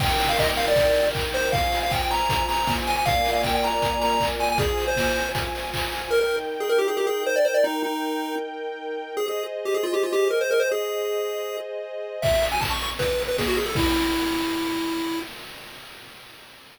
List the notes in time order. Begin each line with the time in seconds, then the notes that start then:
0.00 D#4 A#4 G5, kick, crash
0.20 open hi-hat
0.29 F5
0.38 D#5, kick, clap
0.57 F5, open hi-hat
0.68 D5
0.76 kick, closed hi-hat
0.95 open hi-hat
1.15 kick, clap
1.34 C5, open hi-hat
1.52 F4 C5 F5 G#5, kick, closed hi-hat
1.72 open hi-hat
1.83 F5
1.91 G5, kick, clap
2.02 G5
2.11 A#5, open hi-hat
2.29 kick, closed hi-hat
2.48 A#5, open hi-hat
2.67 kick, snare
2.87 G#5, open hi-hat
2.96 G#5
3.05 A#3 F4 D5 F5 G#5, kick, closed hi-hat
3.25 open hi-hat
3.33 F5
3.43 G5, kick, clap
3.55 G5
3.63 A#5, open hi-hat
3.82 kick, closed hi-hat
4.02 A#5, open hi-hat
4.20 kick, clap
4.40 G#5, open hi-hat
4.49 G#5
4.58 F4 G#4 C5 G#5, kick, closed hi-hat
4.78 open hi-hat
4.87 C5
4.96 kick, snare
5.16 open hi-hat
5.35 kick, closed hi-hat
5.55 open hi-hat
5.74 kick, clap
5.92 open hi-hat
6.11 D#4 A#4 G5
6.21 A#4
6.60 G#4
6.69 A#4
6.78 G4
6.88 G#4
6.97 G4
7.07 G#4
7.26 C5
7.36 D5
7.45 C5
7.54 D5
7.64 D#4
7.83 D#4
9.17 G#4 C5 D#5
9.28 G#4
9.65 G4
9.74 G#4
9.83 F4
9.94 G4
10.03 F4
10.13 G4
10.30 A#4
10.41 C5
10.51 A#4
10.60 C5
10.71 G#4
12.22 E5, kick, crash
12.33 closed hi-hat
12.42 open hi-hat
12.52 G#5, closed hi-hat
12.61 A5, kick, clap
12.70 C#6, closed hi-hat
12.81 C#6, open hi-hat
12.90 closed hi-hat
12.99 B4, kick, closed hi-hat
13.09 closed hi-hat
13.19 open hi-hat
13.28 B4, closed hi-hat
13.38 G#4, kick, snare
13.47 F#4, closed hi-hat
13.57 G#4, open hi-hat
13.66 A4, open hi-hat
13.75 E4, kick, crash